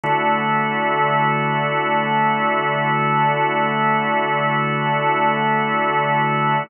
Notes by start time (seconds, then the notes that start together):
0.03 D3 A3 E4 F#4